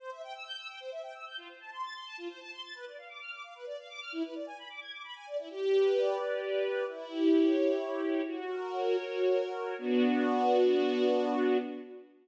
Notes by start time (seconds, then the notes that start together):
0.00 C5
0.11 E5
0.23 G5
0.34 E6
0.46 G6
0.57 E6
0.69 G5
0.80 C5
0.92 E5
1.03 G5
1.15 E6
1.26 G6
1.37 F4
1.49 C5
1.60 A5
1.72 C6
1.83 A6
1.95 C6
2.06 A5
2.18 F4
2.29 C5
2.40 A5
2.52 C6
2.63 A6
2.75 B4
2.86 D5
2.98 F5
3.09 D6
3.21 F6
3.32 D6
3.44 F5
3.55 B4
3.66 D5
3.78 F5
3.89 D6
4.01 F6
4.12 E4
4.24 B4
4.35 D5
4.47 G#5
4.58 B5
4.69 D6
4.81 G#6
4.92 D6
5.04 B5
5.15 G#5
5.27 D5
5.38 E4
5.50 G4
5.72 B4
5.95 D5
6.18 G4
6.41 B4
6.64 D5
6.87 E4
7.10 G4
7.33 C#5
7.56 E4
7.79 G4
8.01 C#5
8.24 F#4
8.48 A#4
8.72 C#5
8.97 F#4
9.23 A#4
9.50 C#5
9.78 B3 D4 F#4